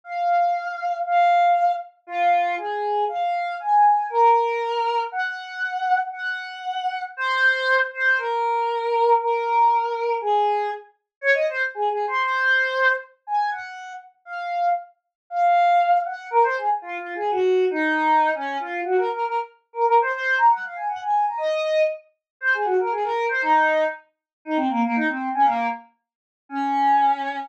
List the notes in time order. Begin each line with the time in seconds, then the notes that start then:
0.04 F5
1.06 F5
2.07 F4
2.58 G#4
3.08 F5
3.60 G#5
4.10 A#4
5.12 F#5
6.12 F#5
7.17 C5
7.93 C5
8.17 A#4
9.20 A#4
10.21 G#4
11.21 C#5
11.34 D#5
11.49 C5
11.75 G#4
11.90 G#4
12.07 C5
12.23 C5
13.27 G#5
13.51 F#5
14.25 F5
15.30 F5
16.05 F#5
16.31 A#4
16.43 C5
16.57 G#4
16.82 F4
16.98 F4
17.15 G#4
17.31 F#4
17.70 D#4
18.35 C#4
18.60 F4
18.84 F#4
18.97 A#4
19.12 A#4
19.25 A#4
19.73 A#4
19.85 A#4
20.01 C5
20.11 C5
20.38 A#5
20.50 F#5
20.64 F5
20.76 G#5
20.88 F#5
21.02 G#5
21.27 A#5
21.38 D#5
22.41 C5
22.54 G#4
22.65 F#4
22.79 A#4
22.91 G#4
23.03 A#4
23.29 C5
23.42 D#4
24.45 D#4
24.56 C4
24.69 A#3
24.83 A#3
24.95 D#4
25.08 C4
25.34 C#4
25.44 A#3
26.49 C#4